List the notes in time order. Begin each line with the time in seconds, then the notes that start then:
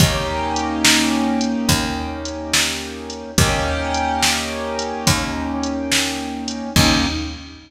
0.00 D#2 A#3 C#4 D#4 G4, kick, closed hi-hat
0.56 closed hi-hat
0.85 snare
1.41 closed hi-hat
1.69 D#2, kick, closed hi-hat
2.25 closed hi-hat
2.54 snare
3.10 closed hi-hat
3.38 D#2 A#3 C#4 D#4 G4, kick, closed hi-hat
3.94 closed hi-hat
4.23 snare
4.79 closed hi-hat
5.07 D#2, kick, closed hi-hat
5.63 closed hi-hat
5.92 snare
6.48 closed hi-hat
6.76 D#2 A#3 C#4 D#4 G4, kick, crash